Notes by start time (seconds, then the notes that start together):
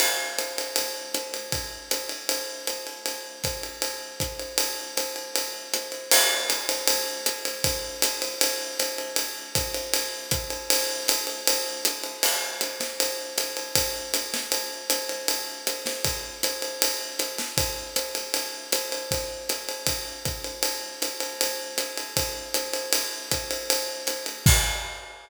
0.00 crash, ride
0.38 hi-hat pedal, ride
0.58 ride
0.76 ride
1.14 hi-hat pedal, ride
1.34 ride
1.52 kick, ride
1.91 hi-hat pedal, ride
2.09 ride
2.29 ride
2.67 hi-hat pedal, ride
2.87 ride
3.06 ride
3.44 kick, hi-hat pedal, ride
3.63 ride
3.82 ride
4.20 kick, hi-hat pedal, ride
4.39 ride
4.58 ride
4.97 hi-hat pedal, ride
5.16 ride
5.36 ride
5.74 hi-hat pedal, ride
5.92 ride
6.11 crash, ride
6.50 hi-hat pedal, ride
6.69 ride
6.88 ride
7.26 hi-hat pedal, ride
7.45 ride
7.64 kick, ride
8.02 hi-hat pedal, ride
8.22 ride
8.41 ride
8.79 hi-hat pedal, ride
8.98 ride
9.16 ride
9.55 kick, hi-hat pedal, ride
9.74 ride
9.94 ride
10.31 kick, hi-hat pedal, ride
10.50 ride
10.70 ride
11.08 hi-hat pedal, ride
11.27 ride
11.47 ride
11.85 hi-hat pedal, ride
12.04 ride
12.23 crash, ride
12.61 hi-hat pedal, ride
12.80 snare, ride
13.00 ride
13.38 hi-hat pedal, ride
13.57 ride
13.75 kick, ride
14.14 hi-hat pedal, ride
14.34 snare, ride
14.52 ride
14.90 hi-hat pedal, ride
15.09 ride
15.28 ride
15.67 hi-hat pedal, ride
15.86 snare, ride
16.05 kick, ride
16.43 hi-hat pedal, ride
16.62 ride
16.82 ride
17.19 hi-hat pedal, ride
17.38 snare, ride
17.57 kick, ride
17.96 hi-hat pedal, ride
18.15 ride
18.34 ride
18.72 hi-hat pedal, ride
18.92 ride
19.11 kick, ride
19.49 hi-hat pedal, ride
19.69 ride
19.87 kick, ride
20.25 kick, hi-hat pedal, ride
20.44 ride
20.63 ride
21.02 hi-hat pedal, ride
21.20 ride
21.41 ride
21.78 hi-hat pedal, ride
21.97 ride
22.17 kick, ride
22.54 hi-hat pedal, ride
22.73 ride
22.93 ride
23.31 kick, hi-hat pedal, ride
23.51 ride
23.70 ride
24.07 hi-hat pedal, ride
24.26 ride
24.46 kick, crash